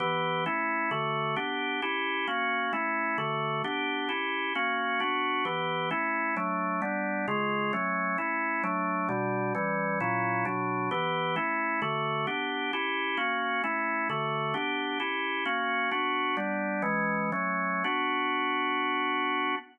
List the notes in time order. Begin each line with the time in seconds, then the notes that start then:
0.00 E3 B3 G4
0.46 A3 C#4 E4
0.91 D3 A3 F#4
1.36 B3 D4 G4
1.82 C#4 E4 G4
2.27 A#3 C#4 F#4
2.73 A3 C#4 E4
3.18 D3 A3 F#4
3.64 B3 D4 G4
4.09 C#4 E4 G4
4.55 A#3 C#4 F#4
5.00 B3 D4 F#4
5.45 E3 B3 G4
5.91 A3 C#4 E4
6.37 F#3 A3 D4
6.82 G3 B3 D4
7.28 C#3 G#3 F4
7.73 F#3 A3 C#4
8.18 A3 C#4 E4
8.64 F#3 A3 D4
9.09 B2 G3 D4
9.55 E3 G3 C#4
10.00 A#2 F#3 C#4 E4
10.45 B2 F#3 D4
10.91 E3 B3 G4
11.36 A3 C#4 E4
11.82 D3 A3 F#4
12.27 B3 D4 G4
12.73 C#4 E4 G4
13.17 A#3 C#4 F#4
13.64 A3 C#4 E4
14.10 D3 A3 F#4
14.54 B3 D4 G4
15.00 C#4 E4 G4
15.45 A#3 C#4 F#4
15.91 B3 D4 F#4
16.37 G3 B3 D4
16.82 E3 G#3 C#4
17.32 F#3 A3 C#4
17.84 B3 D4 F#4